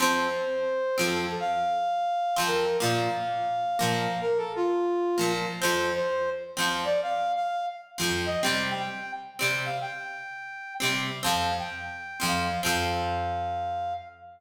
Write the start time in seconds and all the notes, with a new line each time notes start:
0.00 F2 F3 C4 C5
0.98 F2 F3 C4
1.04 A4
1.40 F5
2.36 F2 F3 C4
2.47 A#4
2.80 A#2 F3 A#3 F5
3.79 A#2 F3 A#3
3.87 F5
4.21 A#4
4.37 A4
4.56 F4
5.18 A#2 F3 A#3
5.60 F3 C4 C5
5.64 F2
5.96 C5
6.57 F2 F3 C4
6.85 D5
7.03 F5
7.36 F5
7.98 F2 F3 C4
8.26 D#5
8.42 C3 G3 C4 G5
8.79 G5
9.39 C3 G3 C4
9.65 F5
9.81 G5
10.80 C3 G3 C4
11.23 F2 F3 C4 F5
11.59 G5
12.20 F2 F3 C4
12.27 F5
12.63 F2 F3 C4 F5